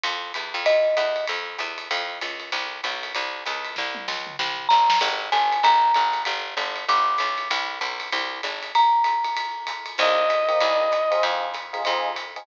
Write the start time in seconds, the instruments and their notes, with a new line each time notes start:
0.03 electric bass (finger) F2, ride
0.34 electric bass (finger) E2, hi-hat pedal, ride
0.54 electric bass (finger) F2, ride
0.66 marimba D#5, ride
0.97 electric bass (finger) E2, hi-hat pedal, ride
1.16 ride
1.27 electric bass (finger) F2, ride
1.58 electric bass (finger) E2, hi-hat pedal, ride
1.78 ride
1.91 electric bass (finger) F2, ride
2.21 electric bass (finger) C#2, hi-hat pedal, ride
2.40 ride
2.52 electric bass (finger) C2, ride
2.83 electric bass (finger) B1, hi-hat pedal, ride
3.03 ride
3.15 electric bass (finger) C2, ride
3.45 electric bass (finger) C#2, hi-hat pedal, ride
3.65 ride
3.76 electric bass (finger) C2, kick, snare
3.95 high tom
4.08 electric bass (finger) C#2, snare
4.27 mid tom
4.39 electric bass (finger) C2, snare
4.58 floor tom
4.69 electric bass (finger) G1, marimba A#5, snare
4.90 snare
5.01 electric bass (finger) G#1, crash, ride
5.32 electric bass (finger) G1, marimba G#5, hi-hat pedal, ride
5.52 ride
5.63 electric bass (finger) G#1, marimba A#5, ride
5.94 electric bass (finger) G#1, hi-hat pedal, ride
6.13 ride
6.25 electric bass (finger) G1, ride
6.57 electric bass (finger) G1, hi-hat pedal, ride
6.76 ride
6.88 electric bass (finger) G1, marimba D6, ride
7.18 electric bass (finger) B1, hi-hat pedal, ride
7.38 ride
7.50 electric bass (finger) C2, kick, ride
7.81 electric bass (finger) B1, kick, hi-hat pedal, ride
8.00 ride
8.12 electric bass (finger) C2, ride
8.43 electric bass (finger) G#1, hi-hat pedal, ride
8.63 ride
8.75 marimba A#5, ride
9.04 hi-hat pedal, ride
9.24 ride
9.37 ride
9.67 kick, hi-hat pedal, ride
9.86 ride
9.98 electric bass (finger) C2, electric piano 1 A#3 C4 D#4 G4, clarinet D#5, kick, crash, ride
10.30 hi-hat pedal, ride
10.48 electric piano 1 A#3 C4 D#4 G4, ride
10.60 electric bass (finger) C2, ride
10.92 kick, hi-hat pedal, ride
11.11 electric piano 1 C4 D#4 F4 G#4, ride
11.23 electric bass (finger) F2, ride
11.54 hi-hat pedal, ride
11.73 electric piano 1 C4 D#4 F4 G#4, ride
11.84 electric bass (finger) F2, electric piano 1 C4 D#4 F4 G#4, kick, ride
12.16 kick, hi-hat pedal, ride
12.36 electric piano 1 C4 D#4 F4 G#4, ride